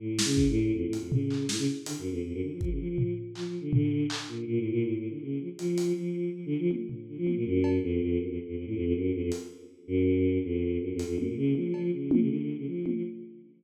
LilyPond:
<<
  \new Staff \with { instrumentName = "Choir Aahs" } { \clef bass \time 5/4 \tempo 4 = 161 \tuplet 3/2 { a,4 des4 a,4 f,8 a,8 f,8 } des4 a,16 des16 r8 | \tuplet 3/2 { d8 ges,8 f,8 } f,16 ges,16 d16 f16 f16 des16 f16 f8. r8 \tuplet 3/2 { f8 f8 d8 } | d4 r8 bes,8 \tuplet 3/2 { bes,8 a,8 bes,8 a,8 a,8 d8 } des8 f16 r16 | f4 f4 \tuplet 3/2 { f8 d8 f8 } r4 d16 f8 bes,16 |
ges,4 f,8 f,8 ges,16 f,16 r16 f,16 f,16 a,16 f,16 f,16 ges,8 f,16 f,16 | r4. ges,4. f,4 \tuplet 3/2 { ges,8 f,8 f,8 } | ges,16 bes,16 des8 f8 f8 des8 f16 des16 d8. des16 f8. f16 | }
  \new DrumStaff \with { instrumentName = "Drums" } \drummode { \time 5/4 r8 sn8 bd4 r8 hh8 tomfh8 hc8 sn4 | hh4 r4 bd4 tomfh4 hc4 | tomfh4 hc4 r4 r4 r4 | hh8 hh8 r4 r4 tommh8 tomfh8 r8 tommh8 |
r8 cb8 r4 r4 r4 r4 | hh4 r4 r4 r4 r8 hh8 | tommh4 tommh8 cb8 r8 tommh8 r4 r8 tommh8 | }
>>